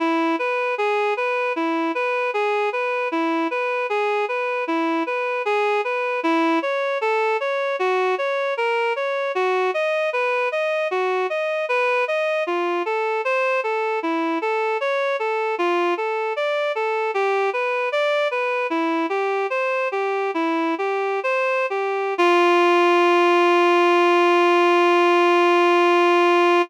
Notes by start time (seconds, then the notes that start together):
0.00 E4
0.39 B4
0.78 G#4
1.17 B4
1.56 E4
1.95 B4
2.34 G#4
2.73 B4
3.12 E4
3.51 B4
3.90 G#4
4.29 B4
4.67 E4
5.06 B4
5.45 G#4
5.84 B4
6.23 E4
6.62 C#5
7.01 A4
7.40 C#5
7.79 F#4
8.18 C#5
8.57 A#4
8.96 C#5
9.35 F#4
9.74 D#5
10.13 B4
10.52 D#5
10.91 F#4
11.30 D#5
11.69 B4
12.08 D#5
12.47 F4
12.86 A4
13.25 C5
13.64 A4
14.03 E4
14.42 A4
14.81 C#5
15.19 A4
15.58 F4
15.97 A4
16.36 D5
16.75 A4
17.14 G4
17.53 B4
17.92 D5
18.31 B4
18.70 E4
19.09 G4
19.50 C5
19.92 G4
20.34 E4
20.78 G4
21.23 C5
21.70 G4
22.18 F4